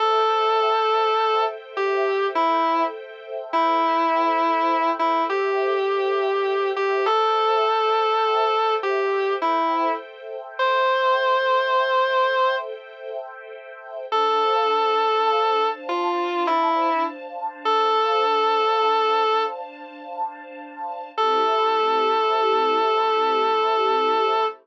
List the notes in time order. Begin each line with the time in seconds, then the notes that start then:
0.00 A4 C5 E5 G5
1.77 G4
2.35 E4
3.53 E4
4.99 E4
5.30 G4
6.76 G4
7.06 A4 C5 E5 G5
8.83 G4
9.42 E4
10.59 C5
14.10 D4 A4 C5 F5 A5
15.89 F4
16.47 E4
17.65 A4
21.18 A3 C4 E4 G4 A4